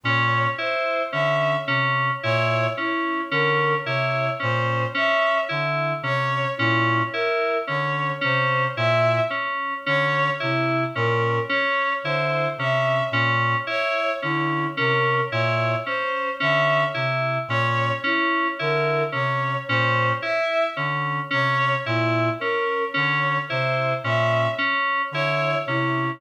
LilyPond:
<<
  \new Staff \with { instrumentName = "Clarinet" } { \clef bass \time 3/4 \tempo 4 = 55 bes,8 r8 d8 c8 bes,8 r8 | d8 c8 bes,8 r8 d8 c8 | bes,8 r8 d8 c8 bes,8 r8 | d8 c8 bes,8 r8 d8 c8 |
bes,8 r8 d8 c8 bes,8 r8 | d8 c8 bes,8 r8 d8 c8 | bes,8 r8 d8 c8 bes,8 r8 | d8 c8 bes,8 r8 d8 c8 | }
  \new Staff \with { instrumentName = "Electric Piano 2" } { \time 3/4 des'8 e'8 des'8 des'8 e'8 des'8 | des'8 e'8 des'8 des'8 e'8 des'8 | des'8 e'8 des'8 des'8 e'8 des'8 | des'8 e'8 des'8 des'8 e'8 des'8 |
des'8 e'8 des'8 des'8 e'8 des'8 | des'8 e'8 des'8 des'8 e'8 des'8 | des'8 e'8 des'8 des'8 e'8 des'8 | des'8 e'8 des'8 des'8 e'8 des'8 | }
  \new Staff \with { instrumentName = "Violin" } { \time 3/4 des''8 c''8 e''8 r8 des''8 e'8 | bes'8 des''8 c''8 e''8 r8 des''8 | e'8 bes'8 des''8 c''8 e''8 r8 | des''8 e'8 bes'8 des''8 c''8 e''8 |
r8 des''8 e'8 bes'8 des''8 c''8 | e''8 r8 des''8 e'8 bes'8 des''8 | c''8 e''8 r8 des''8 e'8 bes'8 | des''8 c''8 e''8 r8 des''8 e'8 | }
>>